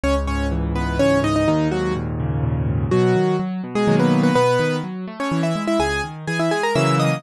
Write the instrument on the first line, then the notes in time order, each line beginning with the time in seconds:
acoustic grand piano
0.04 C#2 C#4 C#5
0.27 G#2 C#4 C#5
0.52 E3
0.76 G#2 B3 B4
0.99 C#2 C#4 C#5
1.24 G#2 D#4 D#5
1.36 D#4 D#5
1.48 D#2 D#3 D#4
1.72 G#2 F#3 F#4
1.96 A#2
2.19 C#3
2.44 A#2
2.68 G#2
2.91 B2 F#3 F#4
3.16 D#3
3.40 F#3
3.64 B2
3.75 G#3 G#4
3.88 B2 D#3 F#3 A#3
4.00 B3 B4
4.23 B3 B4
4.35 B2 B3 B4
4.59 D#3
4.83 F#3
5.08 A3
5.20 C#4 C#5
5.32 E3
5.43 E4 E5
5.55 G#3
5.67 E4 E5
5.79 C#2 G#4 G#5
6.04 D#3
6.27 E3 G#4 G#5
6.39 E4 E5
6.51 G#3 G#4 G#5
6.63 A#4 A#5
6.75 C#3 E3 F#3 A#3 E5 E6
7.00 D#5 D#6